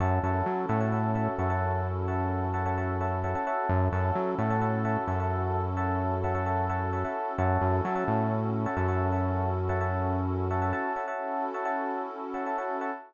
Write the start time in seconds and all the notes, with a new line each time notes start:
0.00 F#2 C#4 E4 F#4 A4 C#5 E5 F#5 A5
0.23 F#2 C#5 E5 F#5 A5
0.46 F#3
0.69 A2 C#5 E5 F#5 A5
0.80 C#5 E5 F#5 A5
0.92 C#5 E5 F#5 A5
1.15 C#5 E5 F#5 A5
1.38 F#2 C#5 E5 F#5 A5
1.50 C#5 E5 F#5 A5
2.08 C#5 E5 F#5 A5
2.54 C#5 E5 F#5 A5
2.66 C#5 E5 F#5 A5
2.78 C#5 E5 F#5 A5
3.01 C#5 E5 F#5 A5
3.24 C#5 E5 F#5 A5
3.35 C#5 E5 F#5 A5
3.47 C#5 E5 F#5 A5
3.69 F#2 C#4 E4 F#4 A4
3.92 F#2 C#5 E5 F#5 A5
4.15 F#3
4.38 A2 C#5 E5 F#5 A5
4.50 C#5 E5 F#5 A5
4.61 C#5 E5 F#5 A5
4.85 C#5 E5 F#5 A5
5.07 F#2 C#5 E5 F#5 A5
5.20 C#5 E5 F#5 A5
5.77 C#5 E5 F#5 A5
6.24 C#5 E5 F#5 A5
6.35 C#5 E5 F#5 A5
6.46 C#5 E5 F#5 A5
6.69 C#5 E5 F#5 A5
6.93 C#5 E5 F#5 A5
7.04 C#5 E5 F#5 A5
7.38 F#2 C#4 E4 F#4 A4 C#5 E5 F#5 A5
7.62 F#2
7.85 F#3 C#5 E5 F#5 A5
7.95 C#5 E5 F#5 A5
8.08 A2
8.66 C#5 E5 F#5 A5
8.77 F#2 C#5 E5 F#5 A5
8.88 C#5 E5 F#5 A5
9.12 C#5 E5 F#5 A5
9.69 C#5 E5 F#5 A5
9.81 C#5 E5 F#5 A5
10.50 C#5 E5 F#5 A5
10.62 C#5 E5 F#5 A5
10.73 C#5 E5 F#5 A5
10.96 C#5 E5 F#5 A5
11.08 C#4 E4 F#4 A4 C#5 E5 F#5 A5
11.54 C#5 E5 F#5 A5
11.65 C#5 E5 F#5 A5
12.34 C#5 E5 F#5 A5
12.46 C#5 E5 F#5 A5
12.58 C#5 E5 F#5 A5
12.81 C#5 E5 F#5 A5